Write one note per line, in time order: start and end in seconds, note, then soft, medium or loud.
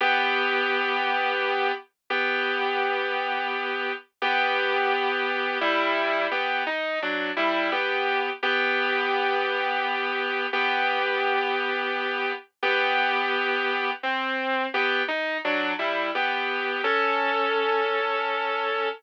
0.01 1.72 B3 loud
0.01 1.72 G4 loud
2.10 3.93 B3 loud
2.10 3.93 G4 loud
4.22 5.58 B3 loud
4.22 5.58 G4 loud
5.61 6.27 G3 loud
5.61 6.27 E4 loud
6.31 6.64 B3 medium
6.31 6.64 G4 loud
6.67 6.99 D#4 loud
7.02 7.31 F#3 medium
7.02 7.31 D4 medium
7.37 7.70 G3 loud
7.37 7.70 E4 loud
7.72 8.30 B3 medium
7.72 8.30 G4 loud
8.43 10.47 B3 loud
8.43 10.47 G4 loud
10.53 12.32 B3 loud
10.53 12.32 G4 loud
12.63 13.91 B3 loud
12.63 13.91 G4 loud
14.03 14.67 C4 loud
14.74 15.03 B3 loud
14.74 15.03 G4 loud
15.08 15.38 D#4 loud
15.45 15.73 F#3 loud
15.45 15.73 D4 loud
15.79 16.11 G3 medium
15.79 16.11 E4 medium
16.15 16.82 B3 medium
16.15 16.82 G4 loud
16.84 18.89 C#4 loud
16.84 18.89 A4 loud